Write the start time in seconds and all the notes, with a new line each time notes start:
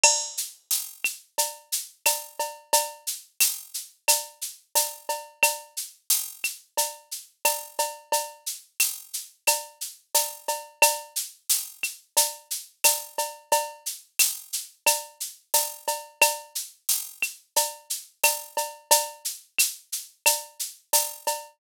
0.04 crash, cowbell, claves
0.37 shaker
0.71 tambourine, shaker
1.04 claves, shaker
1.38 cowbell, shaker
1.72 shaker
2.06 tambourine, cowbell, claves, shaker
2.39 cowbell, shaker
2.73 cowbell, shaker
3.07 shaker
3.40 tambourine, claves, shaker
3.74 shaker
4.08 cowbell, claves, shaker
4.41 shaker
4.75 tambourine, cowbell, shaker
5.09 cowbell, shaker
5.43 cowbell, claves, shaker
5.77 shaker
6.10 tambourine, shaker
6.44 claves, shaker
6.77 cowbell, shaker
7.11 shaker
7.45 tambourine, cowbell, claves, shaker
7.79 cowbell, shaker
8.12 cowbell, shaker
8.46 shaker
8.80 tambourine, claves, shaker
9.13 shaker
9.47 cowbell, claves, shaker
9.81 shaker
10.14 tambourine, cowbell, shaker
10.48 cowbell, shaker
10.82 cowbell, claves, shaker
11.16 shaker
11.50 tambourine, shaker
11.83 claves, shaker
12.17 cowbell, shaker
12.51 shaker
12.84 tambourine, cowbell, claves, shaker
13.18 cowbell, shaker
13.52 cowbell, shaker
13.86 shaker
14.19 tambourine, claves, shaker
14.53 shaker
14.86 cowbell, claves, shaker
15.20 shaker
15.54 tambourine, cowbell, shaker
15.88 cowbell, shaker
16.21 cowbell, claves, shaker
16.55 shaker
16.89 tambourine, shaker
17.22 claves, shaker
17.56 cowbell, shaker
17.90 shaker
18.24 tambourine, cowbell, claves, shaker
18.57 cowbell, shaker
18.91 cowbell, shaker
19.25 shaker
19.59 claves, shaker
19.92 shaker
20.26 cowbell, claves, shaker
20.60 shaker
20.93 tambourine, cowbell, shaker
21.27 cowbell, shaker